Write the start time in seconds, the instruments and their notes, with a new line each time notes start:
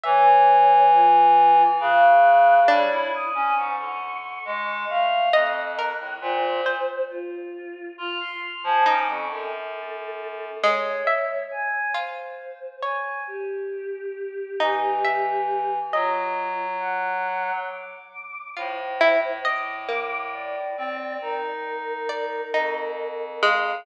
0.03 clarinet E3, choir aahs C#5, harpsichord E5
0.92 choir aahs F4
1.80 clarinet C#3, choir aahs F#6
2.68 clarinet G3, harpsichord D4, choir aahs C#5
2.91 clarinet E4
3.13 choir aahs D#6
3.35 clarinet C#4
3.57 clarinet G#2, choir aahs C#6
3.79 clarinet D3
4.45 clarinet G#3
4.89 clarinet A3, choir aahs F5
5.33 clarinet F2, harpsichord D#5, choir aahs F#6
5.78 harpsichord A#4
6.00 clarinet A2
6.21 clarinet A#2, choir aahs C5
6.66 harpsichord C5
7.09 choir aahs F4
7.98 clarinet F4, choir aahs F6
8.20 choir aahs C6
8.42 choir aahs F6
8.64 clarinet F3, choir aahs G#5
8.86 clarinet C#4, harpsichord D#4, choir aahs D6
9.08 clarinet F2, choir aahs C#6
9.30 clarinet F#2, choir aahs A4
10.63 harpsichord G#3, choir aahs C#5
11.07 harpsichord E5
11.51 choir aahs G#5
11.94 harpsichord F4, choir aahs C5
12.82 harpsichord C#5, choir aahs G#5
13.27 choir aahs G4
14.60 clarinet E3, harpsichord D#4
15.04 harpsichord E5
15.92 clarinet F#3, choir aahs F4, harpsichord D#5
16.80 choir aahs F#5
17.69 choir aahs D6
18.56 clarinet A2, harpsichord F4, choir aahs C5
19.01 harpsichord E4
19.45 harpsichord D#5, choir aahs D6
19.88 harpsichord A#3
20.33 choir aahs D5
20.77 clarinet C4
21.21 clarinet D#4, choir aahs A#4
22.09 harpsichord D5
22.54 clarinet F2, harpsichord D#4
23.42 harpsichord G#3, choir aahs F5